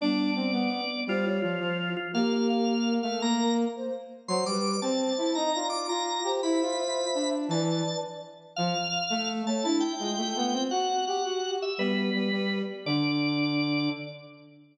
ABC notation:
X:1
M:6/8
L:1/8
Q:3/8=112
K:Ddor
V:1 name="Drawbar Organ"
d4 d2 | F F F3 F | f f f3 f | _b2 z4 |
c' d'2 a3 | _b2 d' b3 | b6 | a3 z3 |
^e5 a | a g5 | ^f2 f3 e | B5 z |
d6 |]
V:2 name="Flute"
[G,B,]4 B,2 | c _d2 c z2 | [G_B]4 B2 | _B B2 c z2 |
c B2 c c2 | _e d2 z2 c | [ce]6 | [Bd]3 z3 |
z5 ^c | D E F4 | z ^F z2 G2 | [G,B,]3 z3 |
D6 |]
V:3 name="Brass Section"
D2 C B,2 z | G,2 F, F,2 z | _B,5 A, | _B,3 z3 |
^F, G,2 C2 E | _E F2 F2 G | E F3 D2 | E,2 z4 |
^E, z2 A,2 A, | E2 ^G, A, B, C | ^F2 G F2 z | G,2 G, G,2 z |
D,6 |]